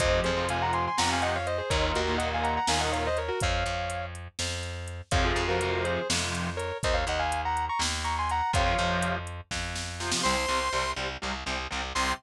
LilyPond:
<<
  \new Staff \with { instrumentName = "Distortion Guitar" } { \time 7/8 \key f \phrygian \tempo 4 = 123 <c'' ees''>8 <aes' c''>8 <f'' aes''>16 <ges'' bes''>16 <aes'' c'''>16 <aes'' c'''>16 <ges'' bes''>16 <f'' aes''>16 <ees'' ges''>16 <des'' f''>16 <c'' ees''>16 <aes' c''>16 | <bes' des''>8 <ges' bes'>8 <ees'' ges''>16 <f'' aes''>16 <ges'' bes''>16 <ges'' bes''>16 <f'' aes''>16 <ees'' ges''>16 <des'' f''>16 <c'' ees''>16 <bes' des''>16 <ges' bes'>16 | <des'' f''>4. r2 | <des'' f''>16 <f' aes'>8 <ges' bes'>8. <aes' c''>8 r4 <bes' des''>8 |
<c'' ees''>16 <des'' f''>16 <ees'' ges''>16 <f'' aes''>8 <ges'' bes''>8 <bes'' des'''>16 r8 <bes'' des'''>16 <aes'' c'''>16 <ges'' bes''>8 | <des'' f''>4. r2 | \key c \phrygian r2. r8 | r2. r8 | }
  \new Staff \with { instrumentName = "Lead 2 (sawtooth)" } { \time 7/8 \key f \phrygian r2. r8 | r2. r8 | r2. r8 | r2. r8 |
r2. r8 | r2. r8 | \key c \phrygian <c'' c'''>4. r2 | c'''4 r2 r8 | }
  \new Staff \with { instrumentName = "Overdriven Guitar" } { \clef bass \time 7/8 \key f \phrygian <c f>8. <c f>16 <c f>4 <c f>4. | <bes, ees>8. <bes, ees>16 <bes, ees>4 <bes, ees>4. | r2. r8 | <c f>8. <c f>16 <c f>4 <c f>4. |
r2. r8 | <c f>16 <c f>16 <c f>2~ <c f>8 <c f>16 <c f>16 | \key c \phrygian <c g>8 <c g>8 <c g>8 <c g>8 <c g>8 <c g>8 <c g>8 | <c g>4 r2 r8 | }
  \new Staff \with { instrumentName = "Electric Bass (finger)" } { \clef bass \time 7/8 \key f \phrygian f,8 f,4. f,4. | ees,8 ees,4. ees,4. | f,8 f,4. f,4. | f,8 f,4. f,4. |
ees,8 ees,4. ees,4. | f,8 f,4. f,4. | \key c \phrygian c,8 c,8 c,8 c,8 c,8 c,8 c,8 | c,4 r2 r8 | }
  \new DrumStaff \with { instrumentName = "Drums" } \drummode { \time 7/8 <hh bd>8 hh8 hh8 hh8 sn8 hh8 hh8 | <hh bd>8 hh8 hh8 hh8 sn8 hh8 hh8 | <hh bd>8 hh8 hh8 hh8 sn8 hh8 hh8 | <hh bd>8 hh8 hh8 hh8 sn8 hh8 hh8 |
<hh bd>8 hh8 hh8 hh8 sn8 hh8 hh8 | <hh bd>8 hh8 hh8 hh8 <bd sn>8 sn8 sn16 sn16 | r4 r4 r4. | r4 r4 r4. | }
>>